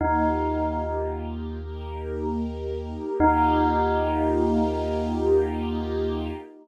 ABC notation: X:1
M:4/4
L:1/8
Q:1/4=75
K:Eb
V:1 name="Tubular Bells"
E3 z5 | E8 |]
V:2 name="Synth Bass 2" clef=bass
E,,8 | E,,8 |]
V:3 name="String Ensemble 1"
[B,EFG]4 [B,EGB]4 | [B,EFG]8 |]